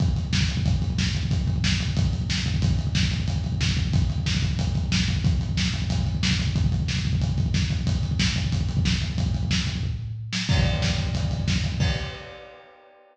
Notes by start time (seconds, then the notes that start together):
0.00 kick, closed hi-hat
0.08 kick
0.16 kick, closed hi-hat
0.25 kick
0.33 kick, snare
0.41 kick
0.49 kick, closed hi-hat
0.57 kick
0.66 kick, closed hi-hat
0.74 kick
0.82 kick, closed hi-hat
0.90 kick
0.98 kick, snare
1.07 kick
1.14 kick, closed hi-hat
1.23 kick
1.31 kick, closed hi-hat
1.39 kick
1.47 kick, closed hi-hat
1.56 kick
1.64 kick, snare
1.72 kick
1.80 kick, closed hi-hat
1.88 kick
1.97 kick, closed hi-hat
2.05 kick
2.13 kick, closed hi-hat
2.22 kick
2.29 kick, snare
2.38 kick
2.46 kick, closed hi-hat
2.54 kick
2.62 kick, closed hi-hat
2.71 kick
2.79 kick, closed hi-hat
2.87 kick
2.95 kick, snare
3.03 kick
3.11 kick, closed hi-hat
3.20 kick
3.28 kick, closed hi-hat
3.36 kick
3.44 kick, closed hi-hat
3.52 kick
3.61 kick, snare
3.69 kick
3.77 kick, closed hi-hat
3.85 kick
3.93 kick, closed hi-hat
4.02 kick
4.10 kick, closed hi-hat
4.18 kick
4.26 kick, snare
4.35 kick
4.42 kick, closed hi-hat
4.51 kick
4.59 kick, closed hi-hat
4.67 kick
4.75 kick, closed hi-hat
4.84 kick
4.92 kick, snare
5.00 kick
5.08 kick, closed hi-hat
5.16 kick
5.24 kick, closed hi-hat
5.33 kick
5.41 kick, closed hi-hat
5.49 kick
5.57 kick, snare
5.66 kick
5.74 kick, closed hi-hat
5.82 kick
5.90 kick, closed hi-hat
5.98 kick
6.07 kick, closed hi-hat
6.15 kick
6.23 kick, snare
6.31 kick
6.39 kick, closed hi-hat
6.47 kick
6.56 kick, closed hi-hat
6.64 kick
6.72 kick, closed hi-hat
6.80 kick
6.88 kick, snare
6.97 kick
7.05 kick, closed hi-hat
7.13 kick
7.21 kick, closed hi-hat
7.29 kick
7.38 kick, closed hi-hat
7.46 kick
7.54 kick, snare
7.62 kick
7.70 kick, closed hi-hat
7.79 kick
7.87 kick, closed hi-hat
7.95 kick
8.03 kick, closed hi-hat
8.11 kick
8.19 kick, snare
8.28 kick
8.36 kick, closed hi-hat
8.44 kick
8.52 kick, closed hi-hat
8.61 kick
8.69 kick, closed hi-hat
8.77 kick
8.85 kick, snare
8.94 kick
9.02 kick, closed hi-hat
9.10 kick
9.18 kick, closed hi-hat
9.26 kick
9.34 kick, closed hi-hat
9.43 kick
9.51 kick, snare
9.59 kick
9.67 kick, closed hi-hat
9.75 kick
9.83 kick, floor tom
10.33 snare
10.49 kick, crash
10.57 kick
10.66 kick, closed hi-hat
10.74 kick
10.82 kick, snare
10.90 kick
10.98 kick, closed hi-hat
11.07 kick
11.15 kick, closed hi-hat
11.23 kick
11.31 kick, closed hi-hat
11.40 kick
11.48 kick, snare
11.56 kick
11.64 kick, closed hi-hat
11.72 kick
11.80 kick, crash